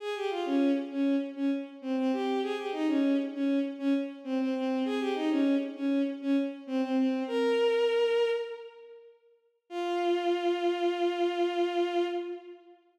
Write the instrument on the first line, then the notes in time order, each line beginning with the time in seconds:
violin
0.00 G#4
0.16 G4
0.30 F4
0.46 C#4
0.91 C#4
1.36 C#4
1.82 C4
1.97 C4
2.13 G4
2.42 G#4
2.57 G4
2.72 D#4
2.88 C#4
3.34 C#4
3.79 C#4
4.24 C4
4.40 C4
4.55 C4
4.85 G#4
5.00 G4
5.15 D#4
5.30 C#4
5.76 C#4
6.22 C#4
6.67 C4
6.82 C4
6.97 C4
7.27 A#4
9.70 F4